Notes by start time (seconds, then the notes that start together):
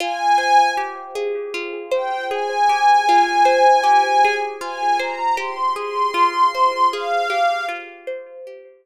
0.00 F4 G#5
0.38 C5
0.77 G4
1.15 G#4
1.54 F4
1.92 C5 G5
2.31 G#4 G#5
2.69 G4
3.09 F4
3.45 C5
3.83 G4
4.25 G#4
4.61 F4 G#5
5.00 C5 A#5
5.37 G4 C6
5.76 G#4 C6
6.14 F4
6.55 C5
6.92 G#4 F5
7.30 G4
7.69 F4
8.07 C5
8.47 G4